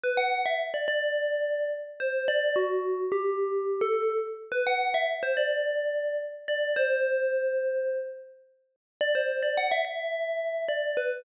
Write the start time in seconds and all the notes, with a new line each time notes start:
0.04 B4
0.17 F#5
0.46 E5
0.74 D5
0.88 D5
2.00 C5
2.28 D5
2.56 F#4
3.12 G4
3.81 A4
4.52 B4
4.67 F#5
4.94 E5
5.23 C5
5.37 D5
6.48 D5
6.76 C5
9.01 D5
9.15 C5
9.43 D5
9.57 F#5
9.71 E5
9.85 E5
10.68 D5
10.97 B4